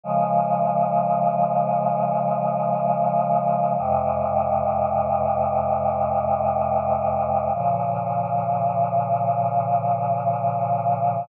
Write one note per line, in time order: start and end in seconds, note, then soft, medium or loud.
0.04 3.75 C#3 loud
0.04 3.75 F3 loud
0.04 3.75 G#3 loud
3.79 7.50 F2 loud
3.79 7.50 C3 loud
3.79 7.50 G#3 medium
7.54 11.25 A#2 loud
7.54 11.25 C#3 medium
7.54 11.25 F3 medium